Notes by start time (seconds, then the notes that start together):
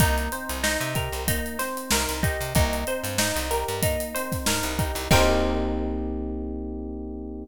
0.00 C2 A#3 D#4, kick, closed hi-hat
0.18 closed hi-hat
0.32 C4 C5, closed hi-hat
0.49 C2, closed hi-hat
0.63 D#4, snare
0.81 C3, closed hi-hat
0.95 G4 A#4, kick, closed hi-hat
1.12 C2, closed hi-hat
1.28 A#3 D#4, kick, closed hi-hat
1.46 closed hi-hat
1.59 C4 C5, snare, closed hi-hat
1.77 closed hi-hat
1.91 C2 D#4 A#4, snare
2.09 C2, closed hi-hat
2.23 D#4 G4, kick, closed hi-hat
2.41 C3, closed hi-hat
2.55 C2 A#3 D#4, kick, closed hi-hat
2.73 closed hi-hat
2.87 C4 C5, closed hi-hat
3.04 G2, snare, closed hi-hat
3.18 D#4, snare
3.36 C2, snare, closed hi-hat
3.51 G4 A#4, snare, closed hi-hat
3.68 G2, closed hi-hat
3.83 A#3 D#4, kick, closed hi-hat
4.00 closed hi-hat
4.15 C4 C5, closed hi-hat
4.32 kick, snare, closed hi-hat
4.46 G2 D#4 A#4, snare
4.63 C2, closed hi-hat
4.79 D#4 G4, kick, closed hi-hat
4.95 C2, closed hi-hat
5.11 C2 A#3 C4 D#4 G4 A#4 C5, kick, crash